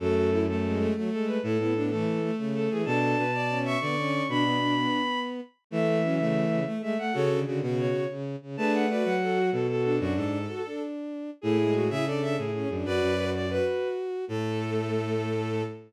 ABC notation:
X:1
M:9/8
L:1/8
Q:3/8=126
K:F#m
V:1 name="Violin"
A3 A3 z A B | A3 A3 z A G | a5 c'4 | b6 z3 |
e3 e3 z e f | c z3 c2 z3 | a f d f3 A A A | F A4 z4 |
[K:A] G3 G A2 G3 | B3 d B3 z2 | A9 |]
V:2 name="Violin"
F F E A,2 A, A,3 | E E D A,2 A, A,3 | A A B d2 e d3 | D B, D3 z4 |
A, A, C A,3 A, A, A, | [FA]2 F F3 z3 | [GB]2 B2 A F z2 D | F A5 z3 |
[K:A] [EG]2 F e d e z3 | [Bd]3 d B z4 | A9 |]
V:3 name="Violin"
A,3 z G,2 F, G,2 | A, B, B, E,3 C,2 E, | D3 z C2 B, C2 | D3 B,5 z |
A,2 F, C,2 C, A, G, A, | C, D, D, C,3 C,2 C, | D2 F4 F F2 | D3 F D5 |
[K:A] A, G,2 E D D E C D | F2 F2 F5 | A,9 |]
V:4 name="Violin"
F,,6 z3 | A,, A,,3 z5 | B,,2 B,,4 D,3 | B,, B,,3 z5 |
E,6 z3 | C,2 C, B,,2 z4 | A,3 F,3 B,,3 | F,, G,,2 z6 |
[K:A] A,,3 C,3 A,,2 F,, | F,, F,,4 z4 | A,,9 |]